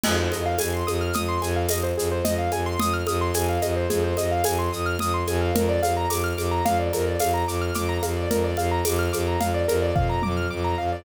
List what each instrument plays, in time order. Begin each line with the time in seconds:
0.04 violin F2, acoustic grand piano G#4, crash, low conga, shaker
0.19 acoustic grand piano C5
0.32 violin F2, acoustic grand piano D#5, high conga, shaker
0.46 acoustic grand piano F5
0.58 violin F2, acoustic grand piano G#5, tambourine, high conga, shaker
0.74 acoustic grand piano C6
0.87 violin F2, acoustic grand piano D#6, high conga, shaker
1.01 acoustic grand piano F6
1.13 violin F2, acoustic grand piano D#6, low conga, shaker
1.28 acoustic grand piano C6
1.42 violin F2, acoustic grand piano G#5, high conga, shaker
1.56 acoustic grand piano F5
1.69 violin F2, acoustic grand piano D#5, tambourine, high conga, shaker
1.83 acoustic grand piano C5
1.97 violin F2, acoustic grand piano G#4, shaker
2.11 acoustic grand piano C5
2.25 violin F2, acoustic grand piano D#5, low conga, shaker
2.38 acoustic grand piano F5
2.51 violin F2, acoustic grand piano G#5, high conga, shaker
2.66 acoustic grand piano C6
2.79 violin F2, acoustic grand piano D#6, low conga, shaker
2.93 acoustic grand piano F6
3.07 violin F2, acoustic grand piano D#6, high conga, shaker
3.21 acoustic grand piano C6
3.34 violin F2, acoustic grand piano G#5, tambourine, high conga, shaker
3.49 acoustic grand piano F5
3.62 violin F2, acoustic grand piano D#5, high conga, shaker
3.76 acoustic grand piano C5
3.90 violin F2, acoustic grand piano G#4, low conga, shaker
4.04 acoustic grand piano C5
4.17 violin F2, acoustic grand piano D#5, high conga, shaker
4.31 acoustic grand piano F5
4.44 violin F2, acoustic grand piano G#5, tambourine, high conga, shaker
4.59 acoustic grand piano C6
4.72 violin F2, acoustic grand piano D#6, shaker
4.86 acoustic grand piano F6
4.99 violin F2, acoustic grand piano D#6, low conga, shaker
5.14 acoustic grand piano C6
5.27 violin F2, acoustic grand piano G#5, high conga, shaker
5.41 acoustic grand piano F5
5.55 violin F2, acoustic grand piano A#4, low conga, shaker
5.69 acoustic grand piano D5
5.83 violin F2, acoustic grand piano F5, high conga, shaker
5.97 acoustic grand piano A#5
6.10 violin F2, acoustic grand piano D6, tambourine, high conga, shaker
6.24 acoustic grand piano F6
6.38 violin F2, acoustic grand piano D6, high conga, shaker
6.51 acoustic grand piano A#5
6.65 violin F2, acoustic grand piano F5, low conga, shaker
6.79 acoustic grand piano D5
6.93 violin F2, acoustic grand piano A#4, high conga, shaker
7.07 acoustic grand piano D5
7.20 violin F2, acoustic grand piano F5, tambourine, high conga, shaker
7.34 acoustic grand piano A#5
7.47 violin F2, acoustic grand piano D6, shaker
7.61 acoustic grand piano F6
7.74 violin F2, acoustic grand piano D6, low conga, shaker
7.89 acoustic grand piano A#5
8.03 violin F2, acoustic grand piano F5, high conga, shaker
8.17 acoustic grand piano D5
8.30 violin F2, acoustic grand piano A#4, low conga, shaker
8.44 acoustic grand piano D5
8.57 violin F2, acoustic grand piano F5, high conga, shaker
8.72 acoustic grand piano A#5
8.85 violin F2, acoustic grand piano D6, tambourine, high conga, shaker
8.99 acoustic grand piano F6
9.13 violin F2, acoustic grand piano D6, high conga, shaker
9.27 acoustic grand piano A#5
9.40 violin F2, acoustic grand piano F5, low conga, shaker
9.54 acoustic grand piano D5
9.68 violin F2, acoustic grand piano A#4, high conga, shaker
9.82 acoustic grand piano D5
9.96 violin F2, acoustic grand piano F5, kick, floor tom
10.09 acoustic grand piano A#5
10.22 violin F2, acoustic grand piano D6, mid tom
10.37 acoustic grand piano F6
10.50 violin F2, acoustic grand piano D6
10.64 acoustic grand piano A#5
10.78 violin F2, acoustic grand piano F5
10.92 acoustic grand piano D5